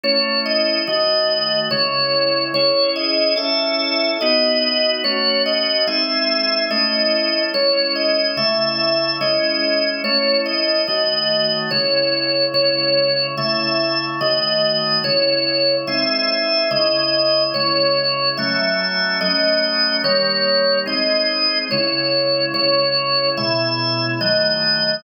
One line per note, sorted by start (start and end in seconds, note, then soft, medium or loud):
0.03 0.85 A3 medium
0.03 0.85 C#4 medium
0.03 0.85 E4 medium
0.03 0.39 C#5 loud
0.46 0.81 D#5 medium
0.87 1.69 D#3 medium
0.87 1.69 A3 medium
0.87 1.69 F#4 medium
0.87 1.59 D#5 medium
1.71 2.53 C#3 medium
1.71 2.53 G#3 medium
1.71 2.53 E4 medium
1.71 2.45 C#5 medium
2.54 3.35 C#4 medium
2.54 3.35 E4 medium
2.54 3.37 G#4 medium
2.54 2.90 C#5 loud
2.96 3.36 D#5 loud
3.36 4.18 C#4 loud
3.36 4.18 E4 medium
3.36 4.18 A4 medium
3.36 4.11 E5 medium
4.21 5.03 B3 medium
4.21 5.03 D#4 medium
4.21 5.03 F#4 loud
4.21 4.90 D#5 loud
5.04 5.86 A3 medium
5.04 5.86 C#4 medium
5.04 5.86 F#4 medium
5.04 5.42 C#5 loud
5.46 5.86 D#5 medium
5.87 6.69 G#3 medium
5.87 6.69 C4 medium
5.87 6.69 D#4 medium
5.87 6.64 E5 loud
6.70 7.52 A3 loud
6.70 7.52 C#4 medium
6.70 7.52 E4 medium
6.70 7.42 D#5 medium
7.54 8.36 G#3 medium
7.54 8.36 C#4 medium
7.54 8.36 E4 medium
7.54 7.94 C#5 loud
7.96 8.31 D#5 medium
8.37 9.19 C#3 medium
8.37 9.19 A3 medium
8.37 9.19 E4 medium
8.37 9.16 E5 loud
9.21 10.03 G#3 medium
9.21 10.03 C#4 loud
9.21 10.03 E4 medium
9.21 9.90 D#5 medium
10.04 10.86 A3 medium
10.04 10.86 C#4 medium
10.04 10.86 E4 medium
10.04 10.39 C#5 loud
10.46 10.81 D#5 medium
10.87 11.70 D#3 medium
10.87 11.70 A3 medium
10.87 11.70 F#4 medium
10.87 11.59 D#5 medium
11.71 12.53 C#3 medium
11.71 12.53 G#3 medium
11.71 12.53 E4 medium
11.71 12.45 C#5 medium
12.54 13.35 C#3 medium
12.54 13.35 G#3 medium
12.54 13.35 E4 medium
12.54 13.27 C#5 loud
13.37 14.20 C#3 medium
13.37 14.20 A3 medium
13.37 14.20 E4 medium
13.37 14.05 E5 medium
14.21 15.03 D#3 medium
14.21 15.03 A3 medium
14.21 15.03 F#4 medium
14.21 14.99 D#5 medium
15.04 15.85 C#3 medium
15.04 15.85 G#3 medium
15.04 15.85 E4 medium
15.04 15.76 C#5 loud
15.87 16.69 G#3 medium
15.87 16.69 C4 medium
15.87 16.69 D#4 medium
15.87 16.68 E5 loud
16.71 17.53 C#3 medium
16.71 17.53 G#3 medium
16.71 17.53 E4 medium
16.71 17.43 D#5 loud
17.54 18.37 C#3 medium
17.54 18.37 G#3 medium
17.54 18.37 E4 medium
17.54 18.29 C#5 loud
18.37 19.20 F#3 medium
18.37 19.20 A3 medium
18.37 19.20 C#4 medium
18.37 19.18 E5 medium
19.21 20.03 F#3 medium
19.21 20.03 A3 medium
19.21 20.03 C#4 medium
19.21 19.96 D#5 loud
20.04 20.85 D#3 medium
20.04 20.85 G3 medium
20.04 20.85 A#3 medium
20.04 20.78 C#5 loud
20.86 21.68 G#3 medium
20.86 21.68 C4 medium
20.86 21.68 D#4 medium
20.86 21.58 D#5 medium
21.71 22.53 C#3 loud
21.71 22.53 G#3 medium
21.71 22.53 E4 medium
21.71 22.46 C#5 medium
22.54 23.36 C#3 medium
22.54 23.36 G#3 medium
22.54 23.36 E4 medium
22.54 23.29 C#5 loud
23.37 24.19 B2 medium
23.37 24.19 G#3 medium
23.37 24.19 E4 medium
23.37 24.05 E5 medium
24.21 25.02 D#3 medium
24.21 25.02 F#3 medium
24.21 25.02 A3 medium
24.21 24.95 D#5 loud